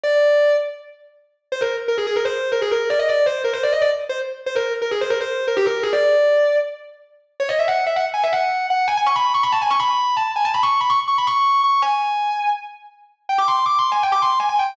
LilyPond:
\new Staff { \time 4/4 \key c \minor \tempo 4 = 163 d''4. r2 r8 | c''16 bes'8 r16 bes'16 aes'16 aes'16 bes'16 c''8. bes'16 aes'16 bes'8 d''16 | ees''16 d''8 c''8 bes'16 c''16 d''16 ees''16 d''16 r8 c''16 r8. | c''16 bes'8 r16 bes'16 aes'16 c''16 bes'16 c''8. bes'16 g'16 bes'8 aes'16 |
d''2 r2 | \key cis \minor cis''16 dis''16 e''16 fis''8 e''16 fis''16 r16 gis''16 e''16 fis''4 fis''8 | gis''16 gis''16 cis'''16 b''8 cis'''16 b''16 a''16 gis''16 cis'''16 b''4 a''8 | gis''16 a''16 b''16 cis'''8 b''16 cis'''16 r16 cis'''16 b''16 cis'''4 cis'''8 |
gis''2 r2 | \key c \minor g''16 d'''16 c'''8 \tuplet 3/2 { d'''8 c'''8 aes''8 } g''16 d'''16 c'''8 aes''16 aes''16 g''8 | }